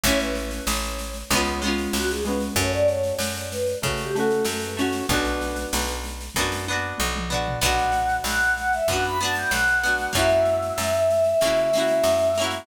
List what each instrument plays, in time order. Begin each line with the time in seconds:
0.04 electric bass (finger) A1, orchestral harp A3 C#4, choir aahs C#5, kick, snare
0.09 orchestral harp E4
0.20 choir aahs B4, snare
0.35 choir aahs B4, snare
0.51 snare
0.67 electric bass (finger) A1, choir aahs C#5, snare
0.83 snare
0.99 snare
1.14 snare
1.30 electric bass (finger) C#2, orchestral harp G#3 B3, choir aahs C#5, kick, snare
1.35 orchestral harp C#4 F4
1.45 snare
1.62 orchestral harp G#3 B3 C#4, snare
1.68 orchestral harp F4
1.78 snare
1.93 electric bass (finger) C#2, choir aahs F#4, snare
2.09 choir aahs G#4, snare
2.25 orchestral harp G#3 B3, choir aahs B4, snare
2.29 orchestral harp C#4 F4
2.40 snare
2.55 electric bass (finger) F#2, orchestral harp A3 C#4, choir aahs C#5, kick, snare
2.61 orchestral harp F#4
2.73 choir aahs D5, snare
2.88 choir aahs C#5, snare
3.04 snare
3.19 electric bass (finger) F#2, snare
3.35 snare
3.51 choir aahs B4, snare
3.66 snare
3.82 electric bass (finger) C#3, orchestral harp A3 C#4, choir aahs C#5, kick, snare
3.86 orchestral harp F#4
3.98 choir aahs G4, snare
4.15 orchestral harp A3 C#4, choir aahs A4, snare
4.19 orchestral harp F#4
4.31 snare
4.45 electric bass (finger) F#2, choir aahs A4, snare
4.60 choir aahs B4, snare
4.77 orchestral harp A3 C#4, choir aahs C#5, snare
4.81 orchestral harp F#4
4.93 snare
5.09 electric bass (finger) B1, orchestral harp B3 D4, choir aahs B4, kick, snare
5.13 orchestral harp F#4
5.25 snare
5.41 snare
5.56 snare
5.73 electric bass (finger) B1, snare
5.87 snare
6.04 snare
6.21 snare
6.35 electric bass (finger) F#2, orchestral harp B3 D4, kick, snare
6.41 orchestral harp F#4
6.52 snare
6.68 orchestral harp B3 D4, high tom
6.72 orchestral harp F#4
6.98 electric bass (finger) B1, mid tom
7.15 mid tom
7.29 orchestral harp B3 D4, floor tom
7.34 orchestral harp F#4
7.48 floor tom
7.61 electric bass (finger) B1, orchestral harp B3 D4, choir aahs F#5, kick, snare, crash
7.66 orchestral harp F#4
7.79 snare
7.92 snare
8.09 snare
8.24 electric bass (finger) B1, choir aahs F#5, snare
8.42 snare
8.57 choir aahs F#5, snare
8.72 choir aahs E5, snare
8.88 electric bass (finger) F#2, orchestral harp B3 D4, choir aahs F#5, kick, snare
8.93 orchestral harp F#4
9.04 choir aahs B5, snare
9.20 orchestral harp B3 D4, choir aahs A5, snare
9.25 orchestral harp F#4
9.35 choir aahs G5, snare
9.51 electric bass (finger) B1, choir aahs F#5, snare
9.68 snare
9.84 orchestral harp B3 D4 F#4, snare
9.98 snare
10.13 electric bass (finger) F#2, orchestral harp A#3 C#4, choir aahs E5, kick, snare
10.17 orchestral harp E4 F#4
10.29 snare
10.46 snare
10.62 snare
10.78 electric bass (finger) F#2, snare
10.94 snare
11.10 snare
11.24 snare
11.41 electric bass (finger) C#3, orchestral harp A#3 C#4, kick, snare
11.45 orchestral harp E4 F#4
11.57 snare
11.73 orchestral harp A#3 C#4, snare
11.78 orchestral harp E4 F#4
11.88 snare
12.04 electric bass (finger) F#2, snare
12.18 snare
12.35 orchestral harp A#3, snare
12.40 orchestral harp C#4 E4
12.44 orchestral harp F#4
12.51 snare